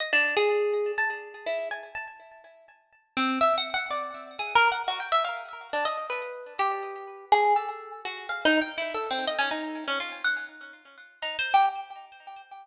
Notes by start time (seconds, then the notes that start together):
0.00 D#5
0.13 D4
0.37 G#4
0.98 A5
1.46 E4
1.71 G#5
1.95 A5
3.17 C4
3.41 E5
3.58 F#5
3.74 F#5
3.91 D5
4.39 G#4
4.55 A#4
4.72 F#5
4.88 F#4
5.00 G5
5.12 E5
5.25 F5
5.73 D4
5.85 D#5
6.10 B4
6.59 G4
7.32 G#4
7.56 A4
8.05 F#4
8.29 F5
8.45 D#4
8.61 G5
8.78 E4
8.94 A4
9.11 C4
9.27 D#5
9.39 C#4
9.51 D#4
9.88 C#4
10.00 F4
10.24 F#5
11.22 D#4
11.39 C5
11.54 G4